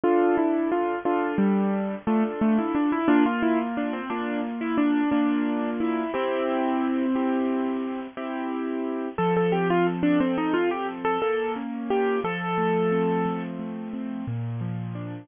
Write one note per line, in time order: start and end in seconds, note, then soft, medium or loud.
0.04 0.95 D4 loud
0.04 0.36 F4 loud
0.04 0.95 A4 loud
0.37 0.69 E4 medium
0.72 0.99 F4 medium
1.05 1.97 D4 medium
1.05 1.36 F4 loud
1.05 1.97 A4 medium
1.38 1.95 G3 loud
2.07 2.23 A3 loud
2.07 2.98 D4 medium
2.07 2.98 F4 medium
2.07 2.98 A4 medium
2.41 2.57 A3 medium
2.58 2.75 E4 medium
2.75 2.91 D4 medium
2.92 3.08 E4 medium
3.08 4.00 A#3 loud
3.08 3.24 D4 loud
3.08 4.00 F4 loud
3.26 3.42 F4 loud
3.43 3.59 E4 medium
3.77 3.93 D4 medium
3.93 4.09 C4 medium
4.10 5.02 A#3 medium
4.10 4.41 D4 medium
4.10 5.02 F4 medium
4.61 4.77 E4 medium
4.78 5.10 D4 medium
5.11 6.04 A#3 medium
5.11 5.70 D4 medium
5.11 6.04 D4 medium
5.11 6.04 F4 medium
5.80 6.12 E4 medium
6.14 8.00 C4 loud
6.14 7.05 E4 loud
6.14 7.05 G4 medium
7.15 8.07 C4 medium
7.15 8.07 E4 medium
7.15 8.07 G4 medium
8.17 9.09 C4 medium
8.17 9.09 E4 medium
8.17 9.09 G4 medium
9.18 10.20 F3 medium
9.18 9.34 A4 medium
9.37 9.53 A4 medium
9.52 10.54 C4 medium
9.52 9.68 G4 medium
9.70 9.86 F4 loud
9.87 10.88 A4 medium
10.03 10.19 D4 loud
10.20 11.17 F3 medium
10.20 10.36 C4 medium
10.38 10.54 D#4 medium
10.54 11.19 C4 medium
10.54 10.70 F4 loud
10.71 10.87 G4 medium
10.88 11.20 A4 medium
11.05 11.21 A4 loud
11.22 12.19 A#3 medium
11.22 11.52 A4 medium
11.56 12.20 C#4 medium
11.90 12.22 F4 medium
11.90 12.20 G4 medium
12.24 13.25 F3 medium
12.24 13.43 A4 loud
12.58 13.59 A3 medium
12.92 13.93 C4 medium
13.26 14.22 F3 medium
13.59 14.24 A3 medium
13.93 14.26 C4 medium
14.27 15.24 A#2 medium
14.61 15.26 F3 medium
14.95 15.27 D4 medium